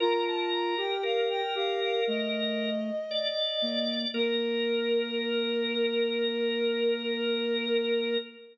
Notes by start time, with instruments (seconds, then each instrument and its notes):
0.00 flute F4 A#5, drawbar organ A#4
0.26 flute A5
0.52 flute A#5
0.77 flute G4 G5
1.03 drawbar organ A#4, flute F5
1.29 flute G5
1.55 flute G4 F5
1.81 flute F5
2.07 flute A3 D#5
3.11 drawbar organ D5
3.62 flute A#3
4.14 flute A#3 A#4, drawbar organ A#4